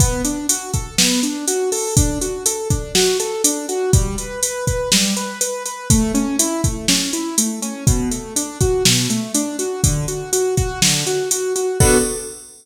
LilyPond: <<
  \new Staff \with { instrumentName = "Acoustic Grand Piano" } { \time 4/4 \key b \minor \tempo 4 = 122 b8 d'8 fis'8 a'8 b8 d'8 fis'8 a'8 | d'8 fis'8 a'8 d'8 fis'8 a'8 d'8 fis'8 | g8 b'8 b'8 b'8 g8 b'8 b'8 b'8 | a8 cis'8 e'8 a8 cis'8 e'8 a8 cis'8 |
b,8 a8 d'8 fis'8 b,8 a8 d'8 fis'8 | d8 fis'8 fis'8 fis'8 d8 fis'8 fis'8 fis'8 | <b d' fis' a'>4 r2. | }
  \new DrumStaff \with { instrumentName = "Drums" } \drummode { \time 4/4 <hh bd>8 hh8 hh8 <hh bd>8 sn8 hh8 hh8 hho8 | <hh bd>8 hh8 hh8 <hh bd>8 sn8 hh8 hh8 hh8 | <hh bd>8 hh8 hh8 <hh bd>8 sn8 hh8 hh8 hh8 | <hh bd>8 hh8 hh8 <hh bd>8 sn8 hh8 hh8 hh8 |
<hh bd>8 hh8 hh8 <hh bd>8 sn8 hh8 hh8 hh8 | <hh bd>8 hh8 hh8 <hh bd>8 sn8 hh8 hh8 hh8 | <cymc bd>4 r4 r4 r4 | }
>>